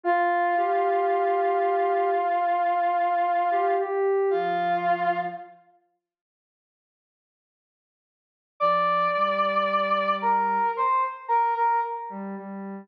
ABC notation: X:1
M:4/4
L:1/16
Q:1/4=56
K:Bbmix
V:1 name="Brass Section"
[Ff]16 | [Ff]4 z12 | [dd']6 [Bb]2 [cc'] z [Bb] [Bb] z4 |]
V:2 name="Ocarina"
F2 G6 z5 G G2 | F,4 z12 | F,2 G,6 z5 G, G,2 |]